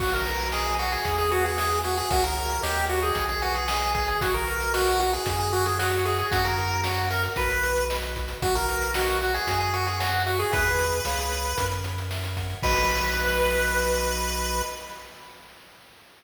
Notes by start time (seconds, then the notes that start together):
0.00 B1 F#4, kick, crash
0.13 A#4, closed hi-hat
0.26 B4, closed hi-hat
0.40 closed hi-hat
0.52 G#4 D#5, snare
0.66 closed hi-hat
0.79 F#4, closed hi-hat
0.92 G#4, closed hi-hat
1.05 E2 G#4, kick, closed hi-hat
1.18 G#4, closed hi-hat
1.31 F#4 B4, closed hi-hat
1.45 G#4, closed hi-hat
1.57 G#4 E5, snare
1.71 closed hi-hat
1.83 F#4 G#4, closed hi-hat
1.97 G#4, closed hi-hat
2.10 C#2 F#4 A#4 C#5 E5, kick, closed hi-hat
2.24 A#4, closed hi-hat
2.37 closed hi-hat
2.50 closed hi-hat
2.62 D#2 G4 A#4 C#5 D#5, snare
2.76 closed hi-hat
2.89 F#4, closed hi-hat
3.03 G#4, closed hi-hat
3.15 B1 G#4, kick, closed hi-hat
3.29 G#4, closed hi-hat
3.42 F#4 B4, closed hi-hat
3.55 G#4, closed hi-hat
3.68 G#4 D#5, snare
3.82 closed hi-hat
3.94 G#4, kick, closed hi-hat
4.08 G#4, closed hi-hat
4.21 B1 F#4, kick, closed hi-hat
4.34 A#4, closed hi-hat
4.47 B4, closed hi-hat
4.60 closed hi-hat
4.73 F#4 D#5, snare
4.88 closed hi-hat
5.00 F#4, closed hi-hat
5.13 G#4, closed hi-hat
5.26 F#2 F#4, kick, closed hi-hat
5.39 G#4, closed hi-hat
5.52 F#4 A#4, closed hi-hat
5.66 G#4, closed hi-hat
5.79 F#4 C#5, snare
5.92 closed hi-hat
6.05 G#4 E5, closed hi-hat
6.18 G#4, closed hi-hat
6.31 F#2 F#4, kick, closed hi-hat
6.45 A#4, closed hi-hat
6.58 A#4, closed hi-hat
6.71 closed hi-hat
6.84 F#4 C#5, snare
6.96 closed hi-hat
7.10 A#4 E5, closed hi-hat
7.23 closed hi-hat
7.36 B1 F#4 B4, kick, closed hi-hat
7.50 closed hi-hat
7.63 B4, closed hi-hat
7.76 closed hi-hat
7.90 D#5, snare
8.02 closed hi-hat
8.16 F#4, kick, closed hi-hat
8.28 closed hi-hat
8.42 B1 F#4, kick, closed hi-hat
8.55 A#4, closed hi-hat
8.68 B4, closed hi-hat
8.82 closed hi-hat
8.94 F#4 D#5, snare
9.08 closed hi-hat
9.21 F#4, closed hi-hat
9.34 G#4, closed hi-hat
9.47 F#2 F#4, kick, closed hi-hat
9.60 G#4, closed hi-hat
9.73 F#4 A#4, closed hi-hat
9.87 G#4, closed hi-hat
10.00 F#4 C#5, snare
10.13 closed hi-hat
10.26 F#4 E5, closed hi-hat
10.39 G#4, closed hi-hat
10.52 E2 G#4 B4 E5, kick, closed hi-hat
10.66 closed hi-hat
10.79 closed hi-hat
10.92 closed hi-hat
11.05 C#2 G#4 C#5 F5, snare
11.19 closed hi-hat
11.32 closed hi-hat
11.45 closed hi-hat
11.57 F#2 A#4, kick, closed hi-hat
11.71 closed hi-hat
11.84 C#5, closed hi-hat
11.98 closed hi-hat
12.11 E5, snare
12.24 closed hi-hat
12.36 F#5, kick, closed hi-hat
12.50 closed hi-hat
12.63 B1 F#4 B4 D#5, kick, crash